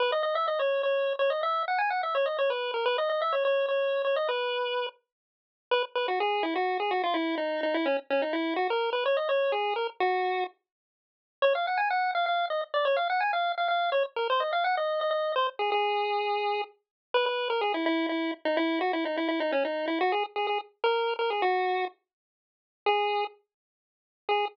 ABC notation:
X:1
M:3/4
L:1/16
Q:1/4=126
K:G#m
V:1 name="Lead 1 (square)"
B d d e d c2 c3 c d | e2 f g f e c d c B2 A | B d d e c c2 c3 c d | B6 z6 |
B z B F G2 E F2 G F =F | E2 D2 D E C z C D E2 | F A2 B c d c2 G2 A z | F4 z8 |
[K:Bbm] d f g a g2 f f2 e z =d | d f g a f2 f f2 d z B | c e f g e2 e e2 c z A | A8 z4 |
[K:G#m] B B2 A G E E2 E2 z D | E2 F E D E E D C D2 E | F G z G G z2 A3 A G | F4 z8 |
G4 z8 | G4 z8 |]